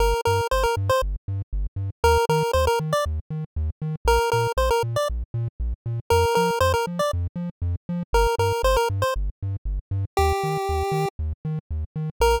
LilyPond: <<
  \new Staff \with { instrumentName = "Lead 1 (square)" } { \time 4/4 \key bes \major \tempo 4 = 118 bes'8 bes'8 c''16 bes'16 r16 c''16 r2 | bes'8 bes'8 c''16 bes'16 r16 d''16 r2 | bes'8 bes'8 c''16 bes'16 r16 d''16 r2 | bes'8 bes'8 c''16 bes'16 r16 d''16 r2 |
bes'8 bes'8 c''16 bes'16 r16 c''16 r2 | g'2 r2 | bes'4 r2. | }
  \new Staff \with { instrumentName = "Synth Bass 1" } { \clef bass \time 4/4 \key bes \major g,,8 g,8 g,,8 g,8 g,,8 g,8 g,,8 g,8 | ees,8 ees8 ees,8 ees8 ees,8 ees8 ees,8 ees8 | bes,,8 bes,8 bes,,8 bes,8 bes,,8 bes,8 bes,,8 bes,8 | f,8 f8 f,8 f8 f,8 f8 f,8 f8 |
g,,8 g,8 g,,8 g,8 g,,8 g,8 g,,8 g,8 | ees,8 ees8 ees,8 ees8 ees,8 ees8 ees,8 ees8 | bes,,4 r2. | }
>>